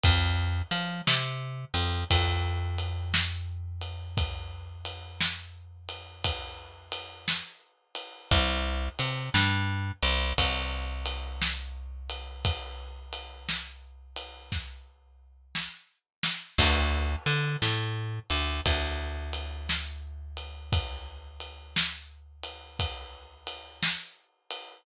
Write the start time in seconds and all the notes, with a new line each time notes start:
0.03 F2, kick, ride
0.71 F3, ride
1.07 C3, snare
1.74 F2, ride
2.10 F2, kick, ride
2.78 ride
3.14 snare
3.81 ride
4.17 kick, ride
4.85 ride
5.20 snare
5.89 ride
6.24 kick, ride
6.92 ride
7.28 snare
7.95 ride
8.31 C2, kick, ride
8.99 C3, ride
9.34 G2, snare
10.03 C2, ride
10.38 C2, kick, ride
11.06 ride
11.42 snare
12.10 ride
12.45 kick, ride
13.13 ride
13.49 snare
14.16 ride
14.52 kick, snare
15.55 snare
16.23 snare
16.58 D2, kick, crash
17.26 D3, ride
17.62 A2, snare
18.30 D2, ride
18.66 D2, kick, ride
19.33 ride
19.69 snare
20.37 ride
20.72 kick, ride
21.40 ride
21.76 snare
22.44 ride
22.79 kick, ride
23.47 ride
23.83 snare
24.51 ride